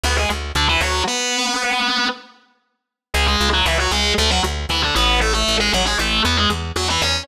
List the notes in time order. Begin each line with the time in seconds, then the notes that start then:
0.03 D2 B3 B4
0.17 G#3 G#4
0.30 D2
0.55 D2 D3 D4
0.68 E3 E4
0.81 D2 F#3 F#4
1.07 B3 B4
3.14 C#2 G#3 G#4
3.27 G#3 G#4
3.41 C#2
3.53 F#3 F#4
3.66 C#2 E3 E4
3.79 F#3 F#4
3.91 C#2 G#3 G#4
4.18 D2 A3 A4
4.30 F#3 F#4
4.44 D2
4.69 D2 E3 E4
4.82 D3 D4
4.95 A1 B3 B4
5.21 A3 A4
5.34 A3 A4
5.48 A1
5.60 G#3 G#4
5.73 A1 F#3 F#4
5.86 G#3 G#4
5.98 A1 A3 A4
6.25 E2 B3 B4
6.37 G#3 G#4
6.50 E2
6.76 E2 F#3 F#4
6.89 E3 E4
7.02 E2 C#4 C#5